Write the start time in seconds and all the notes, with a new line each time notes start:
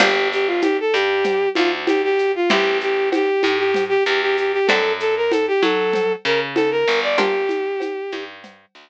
0.00 G1 A#3 D4 F4 G4, crash, cowbell, low conga, shaker
0.32 G4, shaker
0.47 F4
0.62 G4, cowbell, high conga, shaker
0.80 A4
0.93 G2 G4, shaker
1.24 cowbell, low conga, shaker
1.55 D2 F4, high conga, shaker
1.87 G4, cowbell, high conga, shaker
2.04 G4
2.19 shaker
2.36 F4
2.49 A1 A3 C4 E4 G4, cowbell, low conga, shaker
2.80 G4, shaker
3.12 G4, cowbell, high conga, shaker
3.43 A2, high conga, shaker
3.58 G4
3.74 cowbell, low conga, shaker
3.89 G4
4.06 E2 G4, shaker
4.22 G4
4.37 G4, shaker
4.53 G4
4.67 F#2 A3 C4 D4 F#4 A4, cowbell, low conga, shaker
5.00 A4, shaker
5.17 A#4
5.31 A4, cowbell, high conga, shaker
5.48 G4
5.62 F#3 A4, high conga, shaker
5.93 cowbell, low conga, shaker
6.25 C#3 A#4, shaker
6.55 A4, cowbell, high conga, shaker
6.71 A#4
6.88 G1, shaker
7.03 D5
7.18 A#3 D4 F4 G4, cowbell, low conga, shaker
7.49 high conga, shaker
7.80 cowbell, high conga, shaker
8.12 G2, high conga, shaker
8.43 cowbell, low conga, shaker
8.75 D2, shaker